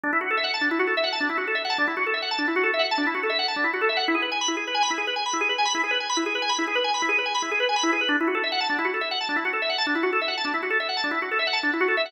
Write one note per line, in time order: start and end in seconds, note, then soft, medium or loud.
0.04 0.11 D4 medium
0.13 0.20 E4 medium
0.21 0.28 F#4 medium
0.31 0.38 A4 medium
0.37 0.45 E5 medium
0.44 0.51 F#5 medium
0.54 0.61 A5 medium
0.61 0.69 D4 medium
0.71 0.79 E4 medium
0.79 0.87 F#4 medium
0.87 0.95 A4 medium
0.97 1.05 E5 medium
1.04 1.11 F#5 medium
1.12 1.20 A5 medium
1.20 1.28 D4 medium
1.29 1.37 E4 medium
1.38 1.45 F#4 medium
1.47 1.55 A4 medium
1.55 1.63 E5 medium
1.65 1.72 F#5 medium
1.70 1.77 A5 medium
1.78 1.86 D4 medium
1.87 1.95 E4 medium
1.97 2.04 F#4 medium
2.07 2.14 A4 medium
2.14 2.21 E5 medium
2.22 2.30 F#5 medium
2.31 2.39 A5 medium
2.39 2.46 D4 medium
2.48 2.55 E4 medium
2.56 2.63 F#4 medium
2.63 2.71 A4 medium
2.74 2.81 E5 medium
2.79 2.87 F#5 medium
2.91 2.99 A5 medium
2.98 3.05 D4 medium
3.07 3.14 E4 medium
3.14 3.22 F#4 medium
3.23 3.31 A4 medium
3.30 3.37 E5 medium
3.39 3.46 F#5 medium
3.48 3.56 A5 medium
3.56 3.64 D4 medium
3.64 3.71 E4 medium
3.73 3.81 F#4 medium
3.81 3.89 A4 medium
3.89 3.97 E5 medium
3.97 4.04 F#5 medium
4.08 4.16 E4 medium
4.14 4.22 G#4 medium
4.22 4.30 B4 medium
4.32 4.39 G#5 medium
4.41 4.49 B5 medium
4.48 4.56 E4 medium
4.57 4.64 G#4 medium
4.67 4.75 B4 medium
4.75 4.82 G#5 medium
4.83 4.90 B5 medium
4.90 4.98 E4 medium
4.98 5.05 G#4 medium
5.07 5.15 B4 medium
5.16 5.24 G#5 medium
5.26 5.33 B5 medium
5.33 5.41 E4 medium
5.41 5.48 G#4 medium
5.49 5.57 B4 medium
5.58 5.66 G#5 medium
5.65 5.73 B5 medium
5.75 5.82 E4 medium
5.84 5.91 G#4 medium
5.91 5.98 B4 medium
6.00 6.08 G#5 medium
6.10 6.17 B5 medium
6.17 6.24 E4 medium
6.26 6.34 G#4 medium
6.35 6.43 B4 medium
6.42 6.50 G#5 medium
6.49 6.57 B5 medium
6.59 6.66 E4 medium
6.67 6.75 G#4 medium
6.75 6.83 B4 medium
6.84 6.92 G#5 medium
6.94 7.02 B5 medium
7.02 7.10 E4 medium
7.09 7.16 G#4 medium
7.18 7.26 B4 medium
7.26 7.33 G#5 medium
7.35 7.42 B5 medium
7.42 7.50 E4 medium
7.51 7.59 G#4 medium
7.60 7.67 B4 medium
7.69 7.76 G#5 medium
7.76 7.84 B5 medium
7.83 7.91 E4 medium
7.93 8.00 G#4 medium
8.01 8.08 B4 medium
8.09 8.16 D4 medium
8.21 8.28 E4 medium
8.28 8.35 F#4 medium
8.35 8.42 A4 medium
8.44 8.51 E5 medium
8.52 8.59 F#5 medium
8.61 8.68 A5 medium
8.70 8.77 D4 medium
8.79 8.86 E4 medium
8.85 8.92 F#4 medium
8.94 9.01 A4 medium
9.01 9.09 E5 medium
9.11 9.19 F#5 medium
9.21 9.28 A5 medium
9.29 9.36 D4 medium
9.36 9.44 E4 medium
9.45 9.52 F#4 medium
9.53 9.61 A4 medium
9.62 9.70 E5 medium
9.70 9.77 F#5 medium
9.78 9.86 A5 medium
9.87 9.94 D4 medium
9.95 10.03 E4 medium
10.03 10.11 F#4 medium
10.13 10.20 A4 medium
10.21 10.29 E5 medium
10.28 10.36 F#5 medium
10.37 10.45 A5 medium
10.45 10.52 D4 medium
10.54 10.61 E4 medium
10.63 10.70 F#4 medium
10.70 10.78 A4 medium
10.80 10.88 E5 medium
10.89 10.96 F#5 medium
10.97 11.04 A5 medium
11.04 11.11 D4 medium
11.11 11.19 E4 medium
11.22 11.30 F#4 medium
11.31 11.39 A4 medium
11.39 11.47 E5 medium
11.47 11.55 F#5 medium
11.53 11.61 A5 medium
11.63 11.71 D4 medium
11.73 11.81 E4 medium
11.80 11.88 F#4 medium
11.88 11.96 A4 medium
11.97 12.05 E5 medium
12.06 12.12 F#5 medium